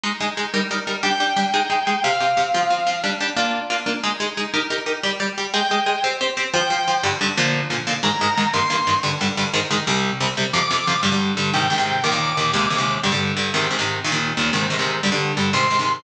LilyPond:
<<
  \new Staff \with { instrumentName = "Distortion Guitar" } { \time 6/8 \key g \phrygian \tempo 4. = 120 r2. | g''2. | f''2. | r2. |
r2. | r4. g''4. | r4. g''4. | r2. |
bes''4. c'''4. | r2. | r4. d'''4. | r4. g''4. |
d'''2. | r2. | r2. | r4. c'''4. | }
  \new Staff \with { instrumentName = "Overdriven Guitar" } { \time 6/8 \key g \phrygian <aes ees' aes'>8 <aes ees' aes'>8 <aes ees' aes'>8 <g ees' bes'>8 <g ees' bes'>8 <g ees' bes'>8 | <g d' g'>8 <g d' g'>8 <g d' g'>8 <aes ees' aes'>8 <aes ees' aes'>8 <aes ees' aes'>8 | <c c' g'>8 <c c' g'>8 <c c' g'>8 <f c' f'>8 <f c' f'>8 <f c' f'>8 | <g d' g'>8 <g d' g'>8 <bes d' f'>4 <bes d' f'>8 <bes d' f'>8 |
<aes ees' aes'>8 <aes ees' aes'>8 <aes ees' aes'>8 <ees' g' bes'>8 <ees' g' bes'>8 <ees' g' bes'>8 | <g g' d''>8 <g g' d''>8 <g g' d''>8 <aes aes' ees''>8 <aes aes' ees''>8 <aes aes' ees''>8 | <c' g' c''>8 <c' g' c''>8 <c' g' c''>8 <f f' c''>8 <f f' c''>8 <f f' c''>8 | <g, d g>8 <g, d g>8 <bes, d f>4 <bes, d f>8 <bes, d f>8 |
<aes, ees aes>8 <aes, ees aes>8 <aes, ees aes>8 <g, ees bes>8 <g, ees bes>8 <g, ees bes>8 | <g, d g>8 <g, d g>8 <g, d g>8 <aes, ees aes>8 <aes, ees aes>8 <c, c g>8~ | <c, c g>8 <c, c g>8 <c, c g>8 <f, c f>8 <f, c f>8 <f, c f>8 | <g, d g>16 <g, d g>8. <g, d g>8 <aes, c ees>8 <aes, c ees>16 <aes, c ees>8. |
<ees, bes, ees>16 <ees, bes, ees>8. <ees, bes, ees>8 <ees, c aes>8 <ees, c aes>16 <ees, c aes>8. | <g, d g>16 <g, d g>8. <g, d g>8 <aes, c ees>8 <aes, c ees>16 <aes, c ees>8. | <ees, bes, ees>16 <ees, bes, ees>8. <ees, bes, ees>8 <aes, c ees>8 <aes, c ees>16 <aes, c ees>8. | <g, d g>16 <g, d g>8. <g, d g>8 <aes, c ees>8 <aes, c ees>16 <aes, c ees>8. | }
>>